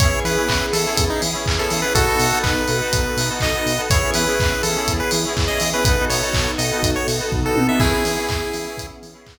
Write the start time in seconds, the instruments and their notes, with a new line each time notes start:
0.00 synth bass 1 E2, pad 5 (bowed) B3 C#4 E4 G#4, electric piano 2 B3 C#4 E4 G#4, lead 1 (square) C#5, kick, closed hi-hat
0.12 electric piano 2 B3 C#4 E4 G#4
0.24 synth bass 1 E3, lead 1 (square) B4, open hi-hat
0.37 electric piano 2 B3 C#4 E4 G#4
0.49 synth bass 1 E2, kick, clap
0.73 synth bass 1 E3, lead 1 (square) A4, open hi-hat
0.85 electric piano 2 B3 C#4 E4 G#4
0.97 synth bass 1 E2, kick, closed hi-hat
1.10 lead 1 (square) D#4
1.22 synth bass 1 E3, open hi-hat
1.33 electric piano 2 B3 C#4 E4 G#4
1.46 synth bass 1 E2, kick, clap
1.58 electric piano 2 B3 C#4 E4 G#4, lead 1 (square) A4
1.70 synth bass 1 E3, open hi-hat
1.82 electric piano 2 B3 C#4 E4 G#4, lead 1 (square) B4
1.95 synth bass 1 B1, pad 5 (bowed) B3 D#4 F#4 A4, electric piano 2 B3 D#4 F#4 A4, lead 1 (square) F#4 A4, kick, closed hi-hat
2.07 electric piano 2 B3 D#4 F#4 A4
2.19 synth bass 1 B2, open hi-hat
2.31 electric piano 2 B3 D#4 F#4 A4
2.43 synth bass 1 B1, lead 1 (square) B4, kick, clap
2.68 synth bass 1 B2, open hi-hat
2.81 electric piano 2 B3 D#4 F#4 A4
2.93 synth bass 1 B1, kick, closed hi-hat
3.17 synth bass 1 B2, open hi-hat
3.29 electric piano 2 B3 D#4 F#4 A4
3.40 synth bass 1 B1, lead 1 (square) D#5, kick, clap
3.53 electric piano 2 B3 D#4 F#4 A4
3.66 synth bass 1 B2, open hi-hat
3.77 electric piano 2 B3 D#4 F#4 A4
3.90 synth bass 1 E2, electric piano 2 B3 C#4 E4 G#4, pad 5 (bowed) B3 C#4 E4 G#4, lead 1 (square) C#5, kick, closed hi-hat
4.02 electric piano 2 B3 C#4 E4 G#4
4.14 synth bass 1 E3, lead 1 (square) B4, open hi-hat
4.27 electric piano 2 B3 C#4 E4 G#4
4.39 synth bass 1 E2, kick, clap
4.63 synth bass 1 E3, lead 1 (square) A4, open hi-hat
4.76 electric piano 2 B3 C#4 E4 G#4
4.88 synth bass 1 E2, kick, closed hi-hat
5.00 lead 1 (square) B4
5.11 synth bass 1 E3, open hi-hat
5.25 electric piano 2 B3 C#4 E4 G#4
5.37 synth bass 1 E2, kick, clap
5.48 electric piano 2 B3 C#4 E4 G#4, lead 1 (square) D#5
5.60 synth bass 1 E3, open hi-hat
5.73 electric piano 2 B3 C#4 E4 G#4, lead 1 (square) B4
5.85 synth bass 1 B1, electric piano 2 B3 D#4 F#4 A4, pad 5 (bowed) B3 D#4 F#4 A4, lead 1 (square) B4, kick, closed hi-hat
5.99 electric piano 2 B3 D#4 F#4 A4
6.09 synth bass 1 B2, lead 1 (square) C#5, open hi-hat
6.21 electric piano 2 B3 D#4 F#4 A4
6.33 synth bass 1 B1, kick, clap
6.58 synth bass 1 B2, lead 1 (square) D#5, open hi-hat
6.71 electric piano 2 B3 D#4 F#4 A4
6.83 synth bass 1 B1, kick, closed hi-hat
6.96 lead 1 (square) C#5
7.08 synth bass 1 B2, open hi-hat
7.19 electric piano 2 B3 D#4 F#4 A4
7.32 synth bass 1 B1, kick, floor tom
7.44 electric piano 2 B3 D#4 F#4 A4, lead 1 (square) A4
7.56 synth bass 1 B2, high tom
7.68 electric piano 2 B3 D#4 F#4 A4, lead 1 (square) E5
7.80 synth bass 1 E2, pad 5 (bowed) B3 C#4 E4 G#4, electric piano 2 B3 C#4 E4 G#4, lead 1 (square) E4 G#4, kick, crash
7.92 electric piano 2 B3 C#4 E4 G#4
8.05 synth bass 1 E3, open hi-hat
8.17 electric piano 2 B3 C#4 E4 G#4
8.29 synth bass 1 E2, kick, clap
8.53 synth bass 1 E3, open hi-hat
8.65 electric piano 2 B3 C#4 E4 G#4
8.77 synth bass 1 E2, kick, closed hi-hat
9.02 synth bass 1 E3, open hi-hat
9.13 electric piano 2 B3 C#4 E4 G#4
9.26 synth bass 1 E2, kick, clap